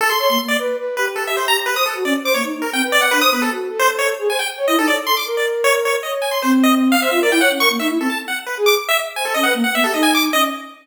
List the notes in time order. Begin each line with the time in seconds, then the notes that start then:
0.01 A4
0.10 C6
0.19 C#5 C6
0.29 A#3 C6
0.39 A#3
0.48 D5
0.59 B4
0.78 B4
0.97 G4 B4
1.16 A4
1.27 E5
1.37 C5
1.48 A#5
1.66 B4
1.76 C5 D#6
1.86 A4
1.95 F#4
2.05 C#4 D5
2.24 C5 D6
2.34 A#3 C#5
2.43 D#4
2.53 D#4
2.62 A#4
2.73 C4 G5
2.82 B4
2.92 D5
3.01 F#5
3.11 D4 B4
3.21 C5 D#6
3.31 B3 B4
3.42 A4
3.51 F#4
3.70 A4
3.79 C5
3.99 C#5
4.19 G#4
4.29 C5 G#5
4.39 G5
4.58 C#5
4.67 E4 D#5
4.77 D#4 A4
4.87 C#5 D5
5.06 A4 C6
5.17 D6
5.26 A#4
5.37 D5
5.64 C#5
5.85 C#5
6.03 C#5 D#5
6.22 G#5
6.31 C6
6.42 C4 C5
6.63 D#5
6.92 F5
7.01 C5 E5
7.11 F4 E5
7.21 A#4 D5
7.31 E4 G5
7.40 C#5 F#5
7.50 C#4
7.60 A#4 C#6
7.70 A#3
7.79 D#4 E5
7.89 E4
7.99 C4 A4
8.10 A5
8.28 F#5
8.47 B4
8.57 G#4
8.66 D6
8.89 E5
9.16 C5 G#5
9.25 A4
9.34 C#4 D#5
9.43 B4 F#5
9.54 A#3
9.64 F#5
9.74 B3 E5
9.84 G4 A4
9.93 D#4 D#5
10.03 G#5
10.15 D6
10.32 C#4 D#5